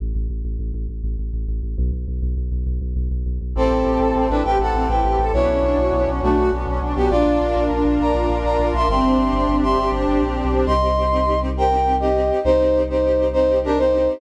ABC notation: X:1
M:12/8
L:1/16
Q:3/8=135
K:Ador
V:1 name="Brass Section"
z24 | z24 | [CA]10 [DB]2 [Bg]2 [Af]4 [Bg]6 | [E^c]12 [A,F]4 z6 [B,G]2 |
[=Fd]8 z4 [d_b]6 [db]4 [ec']2 | [ec']10 [ec']4 z10 | [K:Cdor] [ec']12 [Bg]6 [Ge]6 | [Ec]6 [Ec]6 [Ec]4 [DB]2 [Ec]6 |]
V:2 name="String Ensemble 1"
z24 | z24 | C2 E2 G2 A2 C2 E2 G2 A2 C2 E2 G2 A2 | B,2 ^C2 D2 F2 B,2 C2 D2 F2 B,2 C2 D2 F2 |
D2 =F2 _B2 F2 D2 F2 B2 F2 D2 F2 B2 F2 | C2 D2 G2 D2 C2 D2 G2 D2 C2 D2 G2 D2 | [K:Cdor] [CEG]2 [CEG]2 [CEG]2 [CEG]2 [CEG]2 [CEG]2 [CEG]2 [CEG]2 [CEG]2 [CEG]2 [CEG]2 [CEG]2 | [CEG]2 [CEG]2 [CEG]2 [CEG]2 [CEG]2 [CEG]2 [CEG]2 [CEG]2 [CEG]2 [CEG]2 [CEG]2 [CEG]2 |]
V:3 name="Synth Bass 2" clef=bass
A,,,2 A,,,2 A,,,2 A,,,2 A,,,2 A,,,2 A,,,2 A,,,2 A,,,2 A,,,2 A,,,2 A,,,2 | B,,,2 B,,,2 B,,,2 B,,,2 B,,,2 B,,,2 B,,,2 B,,,2 B,,,2 B,,,2 B,,,2 B,,,2 | A,,,2 A,,,2 A,,,2 A,,,2 A,,,2 A,,,2 A,,,2 A,,,2 A,,,2 A,,,2 A,,,2 A,,,2 | B,,,2 B,,,2 B,,,2 B,,,2 B,,,2 B,,,2 B,,,2 B,,,2 B,,,2 B,,,2 B,,,2 B,,,2 |
_B,,,2 B,,,2 B,,,2 B,,,2 B,,,2 B,,,2 B,,,2 B,,,2 B,,,2 B,,,2 B,,,2 B,,,2 | G,,,2 G,,,2 G,,,2 G,,,2 G,,,2 G,,,2 G,,,2 G,,,2 G,,,2 _B,,,3 =B,,,3 | [K:Cdor] C,,24 | C,,24 |]
V:4 name="Brass Section"
z24 | z24 | [CEGA]24 | [B,^CDF]24 |
[_B,D=F]24 | [CDG]24 | [K:Cdor] z24 | z24 |]